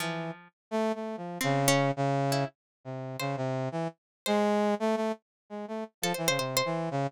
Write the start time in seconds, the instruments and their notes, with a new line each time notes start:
0.00 brass section E3, pizzicato strings F3
0.71 brass section A3
0.95 brass section A3
1.17 brass section F3
1.41 brass section C#3, pizzicato strings C4
1.68 pizzicato strings C#4
1.96 brass section C#3
2.32 pizzicato strings E4
2.85 brass section C3
3.20 brass section C#3, pizzicato strings C5
3.37 brass section C3
3.72 brass section E3
4.26 brass section G#3, pizzicato strings C5
4.80 brass section A3
4.96 brass section A3
5.50 brass section G#3
5.68 brass section A3
6.02 brass section F3, pizzicato strings A4
6.14 brass section E3, pizzicato strings C5
6.28 brass section C#3, pizzicato strings C5
6.38 brass section C3, pizzicato strings C5
6.57 pizzicato strings C5
6.65 brass section E3
6.91 brass section C#3